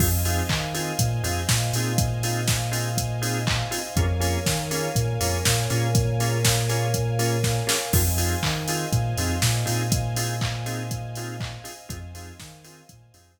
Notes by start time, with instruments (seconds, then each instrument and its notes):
0.00 synth bass 2 F2, drawbar organ C4 D#4 F4 G#4, string ensemble 1 C5 D#5 F5 G#5, kick, crash
0.25 drawbar organ C4 D#4 F4 G#4, open hi-hat
0.49 synth bass 2 D#3, kick, clap
0.74 drawbar organ C4 D#4 F4 G#4, open hi-hat
0.99 synth bass 2 A#2, kick, closed hi-hat
1.23 synth bass 2 F2, drawbar organ C4 D#4 F4 G#4, open hi-hat
1.49 synth bass 2 A#2, kick, snare
1.73 synth bass 2 A#2, drawbar organ C4 D#4 F4 G#4, open hi-hat
1.98 kick, closed hi-hat
2.23 drawbar organ C4 D#4 F4 G#4, open hi-hat
2.48 kick, snare
2.72 drawbar organ C4 D#4 F4 G#4, open hi-hat
2.97 kick, closed hi-hat
3.22 drawbar organ C4 D#4 F4 G#4, open hi-hat
3.47 kick, clap
3.71 drawbar organ C4 D#4 F4 G#4, open hi-hat
3.96 synth bass 2 F2, drawbar organ A#3 C#4 F4 G#4, string ensemble 1 A#4 C#5 F5 G#5, kick, closed hi-hat
4.20 drawbar organ A#3 C#4 F4 G#4, open hi-hat
4.46 synth bass 2 D#3, kick, snare
4.71 drawbar organ A#3 C#4 F4 G#4, open hi-hat
4.95 synth bass 2 A#2, kick, closed hi-hat
5.20 synth bass 2 F2, drawbar organ A#3 C#4 F4 G#4, open hi-hat
5.45 synth bass 2 A#2, kick, snare
5.70 synth bass 2 A#2, drawbar organ A#3 C#4 F4 G#4, open hi-hat
5.95 kick, closed hi-hat
6.20 drawbar organ A#3 C#4 F4 G#4, open hi-hat
6.45 kick, snare
6.69 drawbar organ A#3 C#4 F4 G#4, open hi-hat
6.94 kick, closed hi-hat
7.19 drawbar organ A#3 C#4 F4 G#4, open hi-hat
7.43 kick, snare
7.67 drawbar organ A#3 C#4 F4 G#4, snare
7.93 synth bass 2 F2, drawbar organ C4 D#4 F4 G#4, string ensemble 1 C5 D#5 F5 G#5, kick, crash
8.18 drawbar organ C4 D#4 F4 G#4, open hi-hat
8.43 synth bass 2 D#3, kick, clap
8.68 drawbar organ C4 D#4 F4 G#4, open hi-hat
8.92 synth bass 2 A#2, kick, closed hi-hat
9.17 synth bass 2 F2, drawbar organ C4 D#4 F4 G#4, open hi-hat
9.42 synth bass 2 A#2, kick, snare
9.65 synth bass 2 A#2, drawbar organ C4 D#4 F4 G#4, open hi-hat
9.92 kick, closed hi-hat
10.16 drawbar organ C4 D#4 F4 G#4, open hi-hat
10.41 kick, clap
10.66 drawbar organ C4 D#4 F4 G#4, open hi-hat
10.91 kick, closed hi-hat
11.15 drawbar organ C4 D#4 F4 G#4, open hi-hat
11.40 kick, clap
11.64 drawbar organ C4 D#4 F4 G#4, open hi-hat
11.89 synth bass 2 F2, drawbar organ C4 D#4 F4 G#4, string ensemble 1 C5 D#5 F5 G#5, kick, closed hi-hat
12.15 drawbar organ C4 D#4 F4 G#4, open hi-hat
12.40 synth bass 2 D#3, kick, snare
12.64 drawbar organ C4 D#4 F4 G#4, open hi-hat
12.89 synth bass 2 A#2, kick, closed hi-hat
13.14 synth bass 2 F2, drawbar organ C4 D#4 F4 G#4, open hi-hat
13.39 synth bass 2 A#2, kick